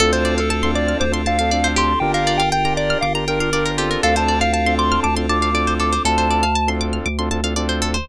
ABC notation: X:1
M:4/4
L:1/16
Q:1/4=119
K:Dm
V:1 name="Lead 1 (square)"
A c2 A A2 d2 c z f4 c'2 | g f2 g g2 d2 f z B4 F2 | f a2 f f2 c'2 a z d'4 d'2 | a6 z10 |]
V:2 name="Lead 2 (sawtooth)"
[CDFA]5 [CDFA]4 [CDFA] [CDFA] [CDFA] [CDFA]4 | [DFGB]5 [DFGB]4 [DFGB] [DFGB] [DFGB] [DFGB]2 [CDFA]2- | [CDFA]5 [CDFA]4 [CDFA] [CDFA] [CDFA] [CDFA]4 | [CDFA]5 [CDFA]4 [CDFA] [CDFA] [CDFA] [CDFA]4 |]
V:3 name="Pizzicato Strings"
A c d f a c' d' f' d' c' a f d c G2- | G B d f g b d' f' d' b g f d B G B | A c d f a c' d' f' d' c' a f d c A c | A c d f a c' d' f' d' c' a f d c A c |]
V:4 name="Synth Bass 2" clef=bass
D,,8 D,,8 | G,,,8 G,,,8 | D,,8 D,,8 | D,,8 D,,8 |]
V:5 name="Pad 5 (bowed)"
[CDFA]16 | [DFGB]16 | [CDFA]16 | z16 |]